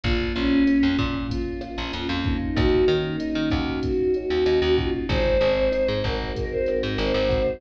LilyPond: <<
  \new Staff \with { instrumentName = "Choir Aahs" } { \time 4/4 \key des \major \tempo 4 = 95 f'8 des'4 r8 f'8 f'4 ees'8 | ges'8 ees'4 r8 ges'8 ges'4 f'8 | c''4. bes'8. c''16 bes'16 bes'16 c''4 | }
  \new Staff \with { instrumentName = "Electric Piano 1" } { \time 4/4 \key des \major bes8 f'8 bes8 des'8 bes8 f'8 des'8 bes8 | bes8 des'8 ees'8 ges'8 bes8 des'8 ees'8 ges'8 | aes8 c'8 ees'8 ges'8 aes8 c'8 ees'8 ges'8 | }
  \new Staff \with { instrumentName = "Electric Bass (finger)" } { \clef bass \time 4/4 \key des \major bes,,8 bes,,8. f,16 bes,4~ bes,16 bes,,16 f,16 f,8. | ees,8 ees8. ees16 ees,4~ ees,16 ees,16 ees,16 ees,8. | aes,,8 aes,,8. aes,16 aes,,4~ aes,,16 aes,16 aes,,16 aes,,8. | }
  \new DrumStaff \with { instrumentName = "Drums" } \drummode { \time 4/4 <hh bd>8 hh8 <hh ss>8 <hh bd>8 <hh bd>8 <hh ss>8 hh8 <hh bd>8 | <hh bd ss>8 hh8 hh8 <hh bd ss>8 <hh bd>8 hh8 <hh ss>8 <hh bd>8 | <hh bd>8 hh8 <hh ss>8 <hh bd>8 <hh bd>8 <hh ss>8 hh8 <hh bd>8 | }
>>